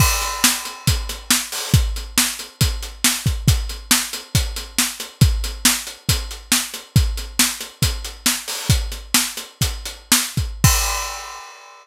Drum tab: CC |x-------|--------|--------|--------|
HH |-x-xxx-o|xx-xxx-x|xx-xxx-x|xx-xxx-x|
SD |--o---o-|--o---o-|--o---o-|--o---o-|
BD |o---o---|o---o--o|o---o---|o---o---|

CC |--------|--------|x-------|
HH |xx-xxx-o|xx-xxx-x|--------|
SD |--o---o-|--o---o-|--------|
BD |o---o---|o---o--o|o-------|